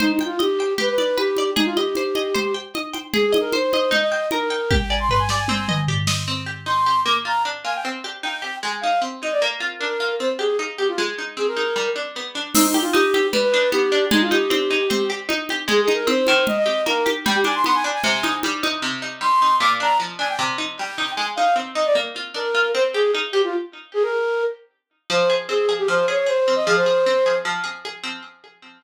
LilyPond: <<
  \new Staff \with { instrumentName = "Flute" } { \time 4/4 \key c \minor \tempo 4 = 153 \tuplet 3/2 { ees'8 ees'8 f'8 } g'4 b'16 b'8. g'4 | ees'16 f'16 g'2~ g'8 r4 | \tuplet 3/2 { aes'8 aes'8 bes'8 } c''4 ees''16 ees''8. bes'4 | g''16 g''16 aes''16 c'''16 c'''16 aes''16 r16 aes''4~ aes''16 r4 |
r4 c'''4 d'''16 r16 bes''8 r8 aes''16 g''16 | r4 g''4 aes''16 r16 f''8 r8 ees''16 d''16 | r4 bes'4 c''16 r16 aes'8 r8 g'16 f'16 | r4 aes'16 bes'4~ bes'16 r4. |
\tuplet 3/2 { ees'8 ees'8 f'8 } g'4 b'16 b'8. g'4 | ees'16 f'16 g'2~ g'8 r4 | \tuplet 3/2 { aes'8 aes'8 bes'8 } c''4 ees''16 ees''8. bes'8 r8 | g''16 g'16 aes''16 c'''16 c'''16 aes''16 r16 aes''4~ aes''16 r4 |
r4 c'''4 d'''16 r16 bes''8 r8 aes''16 g''16 | r4 g''4 aes''16 r16 f''8 r8 ees''16 d''16 | r4 bes'4 c''16 r16 aes'8 r8 g'16 f'16 | r4 aes'16 bes'4~ bes'16 r4. |
\key f \minor c''8. r16 aes'8. g'16 c''8 des''16 des''16 c''8. ees''16 | aes'16 c''4.~ c''16 r2 | }
  \new Staff \with { instrumentName = "Pizzicato Strings" } { \time 4/4 \key c \minor c''8 g''8 ees''8 g''8 g'8 d''8 b'8 d''8 | aes'8 ees''8 c''8 ees''8 c''8 g''8 ees''8 g''8 | aes'8 ees''8 c''8 ees''8 ees'8 g''8 bes'8 g''8 | g'8 d''8 b'8 d''8 c'8 ees''8 g'8 ees''8 |
c'8 g'8 ees'8 g'8 bes8 f'8 d'8 f'8 | c'8 g'8 ees'8 g'8 aes8 ees'8 c'8 ees'8 | bes8 f'8 d'8 f'8 c'8 g'8 ees'8 g'8 | aes8 ees'8 c'8 ees'8 g8 d'8 b8 d'8 |
c'8 g'8 ees'8 g'8 g8 d'8 b8 d'8 | aes8 ees'8 c'8 ees'8 c'8 g'8 ees'8 g'8 | aes8 ees'8 c'8 ees4 g'8 bes8 g'8 | g8 d'8 b8 d'8 c8 ees'8 g8 ees'8 |
c8 ees'8 g8 ees'8 bes,8 d'8 f8 d'8 | c8 ees'8 g8 ees'8 aes8 ees'8 c'8 ees'8 | bes8 f'8 d'8 f'8 c'8 g'8 ees'8 g'8 | r1 |
\key f \minor f8 aes'8 c'8 aes'8 f8 aes'8 aes'8 c'8 | f8 aes'8 c'8 aes'8 f8 aes'8 aes'8 c'8 | }
  \new DrumStaff \with { instrumentName = "Drums" } \drummode { \time 4/4 cgl8 cgho8 cgho4 cgl8 cgho8 cgho8 cgho8 | cgl8 cgho8 cgho8 cgho8 cgl4 cgho8 cgho8 | cgl8 cgho8 cgho8 cgho8 cgl4 cgho4 | <bd tommh>4 tomfh8 sn8 tommh8 toml8 tomfh8 sn8 |
r4 r4 r4 r4 | r4 r4 r4 r4 | r4 r4 r4 r4 | r4 r4 r4 r4 |
<cgl cymc>8 cgho8 cgho8 cgho8 cgl4 cgho4 | cgl8 cgho8 cgho4 cgl4 cgho8 cgho8 | cgl8 cgho8 cgho8 cgho8 cgl4 cgho8 cgho8 | cgl8 cgho8 cgho4 cgl8 cgho8 cgho8 cgho8 |
r4 r4 r4 r4 | r4 r4 r4 r4 | r4 r4 r4 r4 | r4 r4 r4 r4 |
r4 r4 r4 r4 | r4 r4 r4 r4 | }
>>